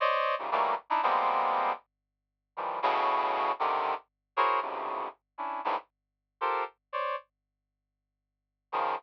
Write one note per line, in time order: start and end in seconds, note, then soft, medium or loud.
0.00 0.35 C5 medium
0.00 0.35 C#5 medium
0.00 0.35 D5 medium
0.00 0.35 D#5 medium
0.39 0.50 G#2 medium
0.39 0.50 A#2 medium
0.39 0.50 C3 medium
0.39 0.50 C#3 medium
0.51 0.75 D#3 medium
0.51 0.75 E3 medium
0.51 0.75 F#3 medium
0.51 0.75 G3 medium
0.51 0.75 A3 medium
0.51 0.75 A#3 medium
0.90 1.01 D4 medium
0.90 1.01 D#4 medium
0.90 1.01 E4 medium
1.03 1.72 F3 medium
1.03 1.72 G3 medium
1.03 1.72 G#3 medium
1.03 1.72 A#3 medium
1.03 1.72 B3 medium
1.03 1.72 C4 medium
2.57 2.80 D#3 medium
2.57 2.80 E3 medium
2.57 2.80 F3 medium
2.57 2.80 G3 medium
2.82 3.52 A2 loud
2.82 3.52 B2 loud
2.82 3.52 C#3 loud
3.59 3.94 C3 medium
3.59 3.94 D3 medium
3.59 3.94 D#3 medium
4.37 4.60 E4 medium
4.37 4.60 F#4 medium
4.37 4.60 G#4 medium
4.37 4.60 A#4 medium
4.37 4.60 C5 medium
4.37 4.60 C#5 medium
4.62 5.08 F#2 medium
4.62 5.08 G#2 medium
4.62 5.08 A2 medium
4.62 5.08 B2 medium
4.62 5.08 C3 medium
4.62 5.08 C#3 medium
5.38 5.61 C#4 soft
5.38 5.61 D4 soft
5.38 5.61 E4 soft
5.65 5.76 G2 medium
5.65 5.76 G#2 medium
5.65 5.76 A2 medium
6.41 6.64 F4 medium
6.41 6.64 G4 medium
6.41 6.64 A4 medium
6.41 6.64 A#4 medium
6.41 6.64 C5 medium
6.93 7.16 C5 medium
6.93 7.16 C#5 medium
6.93 7.16 D5 medium
8.72 8.95 C#3 medium
8.72 8.95 D#3 medium
8.72 8.95 F3 medium